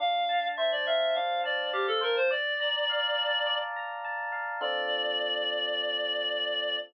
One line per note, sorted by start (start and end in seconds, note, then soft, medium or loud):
0.00 1.16 D4 loud
0.00 0.48 F5 loud
0.29 1.43 A5 medium
0.57 2.00 C5 medium
0.57 0.70 E5 medium
0.72 0.86 D5 loud
0.86 1.14 E5 loud
0.86 1.73 F5 medium
1.15 2.26 D4 loud
1.15 1.41 F5 medium
1.44 1.70 D5 medium
1.44 2.26 A5 medium
1.73 1.87 G4 loud
1.73 2.28 F5 medium
1.87 2.01 A4 loud
2.01 2.16 A#4 loud
2.01 2.28 C5 medium
2.16 2.30 C5 loud
2.31 3.46 D5 loud
2.31 3.59 D5 loud
2.60 3.76 A#5 medium
2.90 4.32 F5 medium
3.18 4.04 A5 medium
3.46 4.56 D5 medium
3.76 4.58 A#5 medium
4.04 4.59 A5 medium
4.32 4.59 F5 medium
4.61 6.77 D3 loud
4.61 6.77 C4 medium
4.61 6.77 F4 loud
4.61 6.77 A4 medium
4.61 6.78 D5 loud